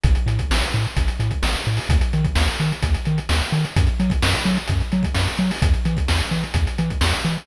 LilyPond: <<
  \new Staff \with { instrumentName = "Synth Bass 1" } { \clef bass \time 4/4 \key e \major \tempo 4 = 129 a,,8 a,8 a,,8 a,8 a,,8 a,8 a,,8 a,8 | dis,8 dis8 dis,8 dis8 dis,8 dis8 dis,8 dis8 | fis,8 fis8 fis,8 fis8 fis,8 fis8 fis,8 fis8 | e,8 e8 e,8 e8 e,8 e8 e,8 e8 | }
  \new DrumStaff \with { instrumentName = "Drums" } \drummode { \time 4/4 <hh bd>16 hh16 hh16 <hh bd>16 sn16 hh16 hh16 hh16 <hh bd>16 hh16 hh16 <hh bd>16 sn16 hh16 hh16 hho16 | <hh bd>16 hh16 hh16 <hh bd>16 sn16 hh16 hh16 hh16 <hh bd>16 hh16 hh16 hh16 sn16 hh16 hh16 hh16 | <hh bd>16 hh16 hh16 <hh bd>16 sn16 hh16 hh16 hh16 <hh bd>16 hh16 hh16 <hh bd>16 sn16 hh16 hh16 hho16 | <hh bd>16 hh16 hh16 <hh bd>16 sn16 hh16 hh16 hh16 <hh bd>16 hh16 hh16 <hh bd>16 sn16 hh16 hh16 hho16 | }
>>